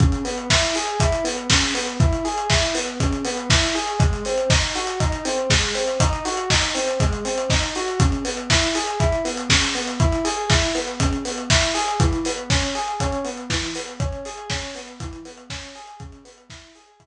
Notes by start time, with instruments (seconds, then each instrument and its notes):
0.00 electric piano 1 C#3, kick, closed hi-hat
0.12 closed hi-hat
0.25 electric piano 1 B3, open hi-hat
0.38 closed hi-hat
0.50 electric piano 1 E4, kick, snare
0.63 closed hi-hat
0.75 electric piano 1 G#4, open hi-hat
0.88 closed hi-hat
1.00 electric piano 1 E4, kick, closed hi-hat
1.12 closed hi-hat
1.24 electric piano 1 B3, open hi-hat
1.38 closed hi-hat
1.50 electric piano 1 C#3, kick, snare
1.62 closed hi-hat
1.74 electric piano 1 B3, open hi-hat
1.87 closed hi-hat
2.00 electric piano 1 E4, kick, closed hi-hat
2.12 closed hi-hat
2.25 electric piano 1 G#4, open hi-hat
2.38 closed hi-hat
2.50 electric piano 1 E4, kick, snare
2.63 closed hi-hat
2.75 electric piano 1 B3, open hi-hat
2.88 closed hi-hat
3.00 electric piano 1 C#3, kick, closed hi-hat
3.12 closed hi-hat
3.25 electric piano 1 B3, open hi-hat
3.37 closed hi-hat
3.50 electric piano 1 E4, kick, snare
3.62 closed hi-hat
3.75 electric piano 1 G#4, open hi-hat
3.88 closed hi-hat
3.99 electric piano 1 G#3, kick, closed hi-hat
4.13 closed hi-hat
4.25 electric piano 1 C4, open hi-hat
4.38 closed hi-hat
4.50 electric piano 1 D#4, kick, snare
4.62 closed hi-hat
4.75 electric piano 1 F#4, open hi-hat
4.87 closed hi-hat
5.00 electric piano 1 D#4, kick, closed hi-hat
5.12 closed hi-hat
5.25 electric piano 1 C4, open hi-hat
5.38 closed hi-hat
5.50 electric piano 1 G#3, kick, snare
5.62 closed hi-hat
5.75 electric piano 1 C4, open hi-hat
5.88 closed hi-hat
6.00 electric piano 1 D#4, kick, closed hi-hat
6.13 closed hi-hat
6.25 electric piano 1 F#4, open hi-hat
6.37 closed hi-hat
6.50 electric piano 1 D#4, kick, snare
6.62 closed hi-hat
6.75 electric piano 1 C4, open hi-hat
6.88 closed hi-hat
7.00 electric piano 1 G#3, kick, closed hi-hat
7.12 closed hi-hat
7.25 electric piano 1 C4, open hi-hat
7.38 closed hi-hat
7.50 electric piano 1 D#4, kick, snare
7.63 closed hi-hat
7.75 electric piano 1 F#4, open hi-hat
7.88 closed hi-hat
8.00 electric piano 1 C#3, kick, closed hi-hat
8.12 closed hi-hat
8.25 electric piano 1 B3, open hi-hat
8.37 closed hi-hat
8.50 electric piano 1 E4, kick, snare
8.62 closed hi-hat
8.75 electric piano 1 G#4, open hi-hat
8.87 closed hi-hat
9.00 electric piano 1 E4, kick, closed hi-hat
9.12 closed hi-hat
9.25 electric piano 1 B3, open hi-hat
9.37 closed hi-hat
9.50 electric piano 1 C#3, kick, snare
9.62 closed hi-hat
9.75 electric piano 1 B3, open hi-hat
9.88 closed hi-hat
10.00 electric piano 1 E4, kick, closed hi-hat
10.12 closed hi-hat
10.25 electric piano 1 G#4, open hi-hat
10.50 electric piano 1 E4, kick, snare, closed hi-hat
10.63 closed hi-hat
10.75 electric piano 1 B3, open hi-hat
10.88 closed hi-hat
11.00 electric piano 1 C#3, kick, closed hi-hat
11.13 closed hi-hat
11.25 electric piano 1 B3, open hi-hat
11.38 closed hi-hat
11.50 electric piano 1 E4, kick, snare
11.63 closed hi-hat
11.74 electric piano 1 G#4, open hi-hat
11.88 closed hi-hat
12.00 electric piano 1 E3, kick, closed hi-hat
12.13 closed hi-hat
12.25 electric piano 1 B3, open hi-hat
12.37 closed hi-hat
12.50 electric piano 1 C#4, kick, snare
12.62 closed hi-hat
12.75 electric piano 1 G#4, open hi-hat
12.88 closed hi-hat
13.00 electric piano 1 C#4, kick, closed hi-hat
13.12 closed hi-hat
13.24 electric piano 1 B3, open hi-hat
13.37 closed hi-hat
13.50 electric piano 1 E3, kick, snare
13.62 closed hi-hat
13.75 electric piano 1 B3, open hi-hat
13.88 closed hi-hat
14.00 electric piano 1 C#4, kick, closed hi-hat
14.12 closed hi-hat
14.25 electric piano 1 G#4, open hi-hat
14.38 closed hi-hat
14.50 electric piano 1 C#4, kick, snare
14.63 closed hi-hat
14.75 electric piano 1 B3, open hi-hat
14.88 closed hi-hat
15.00 electric piano 1 E3, kick, closed hi-hat
15.13 closed hi-hat
15.25 electric piano 1 B3, open hi-hat
15.37 closed hi-hat
15.50 electric piano 1 C#4, kick, snare
15.63 closed hi-hat
15.75 electric piano 1 G#4, open hi-hat
15.87 closed hi-hat
16.00 electric piano 1 C#3, kick, closed hi-hat
16.12 closed hi-hat
16.25 electric piano 1 B3, open hi-hat
16.38 closed hi-hat
16.50 electric piano 1 E4, kick, snare
16.63 closed hi-hat
16.75 electric piano 1 G#4, open hi-hat
16.88 closed hi-hat
17.00 electric piano 1 E4, kick, closed hi-hat